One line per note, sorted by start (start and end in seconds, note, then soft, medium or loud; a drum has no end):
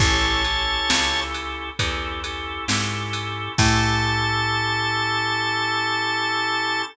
0.00 0.81 A1 medium
0.00 0.42 C#4 loud
0.00 0.42 E4 medium
0.00 0.42 G4 loud
0.00 0.42 A4 loud
0.00 1.21 C#5 medium
0.00 1.21 A5 medium
0.00 kick loud
0.00 crash loud
0.45 1.69 C#4 medium
0.45 1.69 E4 medium
0.45 1.69 G4 medium
0.45 1.69 A4 medium
0.45 ride medium
0.90 1.71 C#2 medium
0.90 snare loud
1.35 ride medium
1.79 2.60 E2 medium
1.79 2.20 C#4 medium
1.79 2.20 E4 medium
1.79 2.20 G4 medium
1.79 2.20 A4 medium
1.79 kick medium
1.79 ride loud
2.24 2.65 C#4 medium
2.24 2.65 E4 medium
2.24 2.65 G4 medium
2.24 2.65 A4 medium
2.24 ride medium
2.68 3.49 G#2 medium
2.68 3.52 C#4 medium
2.68 3.52 E4 medium
2.68 3.52 G4 medium
2.68 3.52 A4 medium
2.68 snare loud
3.13 ride medium
3.58 6.83 A2 loud
3.58 6.83 C#4 loud
3.58 6.83 E4 loud
3.58 6.83 G4 loud
3.58 6.83 A4 loud
3.58 6.82 A5 loud
3.58 kick loud
3.58 crash loud